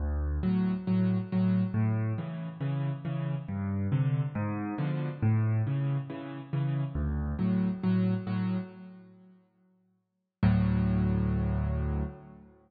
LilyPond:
\new Staff { \clef bass \time 4/4 \key d \major \tempo 4 = 138 d,4 <a, fis>4 <a, fis>4 <a, fis>4 | a,4 <cis e>4 <cis e>4 <cis e>4 | g,4 <c d>4 gis,4 <b, d f>4 | a,4 <cis e>4 <cis e>4 <cis e>4 |
d,4 <a, fis>4 <a, fis>4 <a, fis>4 | r1 | <d, a, fis>1 | }